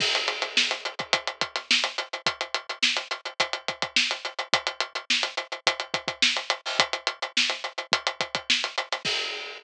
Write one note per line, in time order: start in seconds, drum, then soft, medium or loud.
0.00 kick loud
0.00 crash loud
0.15 snare soft
0.15 closed hi-hat medium
0.28 closed hi-hat medium
0.42 snare soft
0.42 closed hi-hat medium
0.57 snare loud
0.71 snare soft
0.71 closed hi-hat medium
0.85 closed hi-hat medium
0.99 kick medium
0.99 closed hi-hat medium
1.13 kick medium
1.13 closed hi-hat loud
1.27 closed hi-hat medium
1.41 kick medium
1.41 closed hi-hat medium
1.56 snare soft
1.56 closed hi-hat medium
1.71 snare loud
1.84 snare soft
1.84 closed hi-hat medium
1.98 closed hi-hat medium
2.13 closed hi-hat medium
2.26 kick loud
2.26 closed hi-hat loud
2.41 closed hi-hat medium
2.54 closed hi-hat medium
2.69 closed hi-hat medium
2.83 snare loud
2.97 closed hi-hat medium
3.11 closed hi-hat medium
3.25 closed hi-hat medium
3.40 kick medium
3.40 closed hi-hat loud
3.53 closed hi-hat medium
3.68 kick medium
3.68 closed hi-hat medium
3.82 kick medium
3.82 closed hi-hat medium
3.96 snare loud
4.11 closed hi-hat medium
4.25 closed hi-hat medium
4.39 closed hi-hat medium
4.53 kick loud
4.53 closed hi-hat loud
4.67 closed hi-hat medium
4.80 closed hi-hat medium
4.95 closed hi-hat medium
5.10 snare loud
5.23 closed hi-hat medium
5.37 closed hi-hat medium
5.52 closed hi-hat medium
5.67 kick medium
5.67 closed hi-hat loud
5.80 closed hi-hat medium
5.94 kick loud
5.94 closed hi-hat medium
6.08 kick loud
6.08 closed hi-hat medium
6.22 snare loud
6.37 closed hi-hat medium
6.50 closed hi-hat medium
6.66 open hi-hat medium
6.79 kick loud
6.79 closed hi-hat loud
6.93 closed hi-hat medium
7.07 closed hi-hat medium
7.22 closed hi-hat medium
7.37 snare loud
7.50 snare soft
7.50 closed hi-hat medium
7.64 closed hi-hat medium
7.78 closed hi-hat medium
7.92 kick loud
7.92 closed hi-hat loud
8.07 closed hi-hat medium
8.21 kick medium
8.21 closed hi-hat medium
8.35 kick medium
8.35 closed hi-hat medium
8.50 snare loud
8.64 closed hi-hat medium
8.78 closed hi-hat loud
8.92 snare soft
8.92 closed hi-hat medium
9.05 kick loud
9.05 crash loud